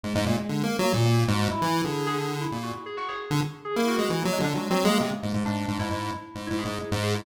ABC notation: X:1
M:2/4
L:1/16
Q:1/4=133
K:none
V:1 name="Lead 1 (square)"
^G,, G,, ^A,, z (3D,2 ^A,2 ^F,2 | ^A,,3 ^G,,2 z E,2 | D,6 ^A,,2 | z5 D, z2 |
z ^A,2 ^G, (3E,2 ^F,2 D,2 | (3^F,2 F,2 ^G,2 C, z ^G,, G,, | ^G,,2 G,, G,, G,,2 z2 | (3^G,,2 G,,2 G,,2 z G,,3 |]
V:2 name="Electric Piano 2"
^G, G, z G,3 z ^A, | z ^A, z ^F2 E2 z | ^G2 G z2 E z ^F | z ^G ^F G z4 |
^G E ^F3 ^A, ^G, D | (3^G,2 C2 ^A,2 G, z G, G, | D3 E3 z2 | z E ^G3 z G E |]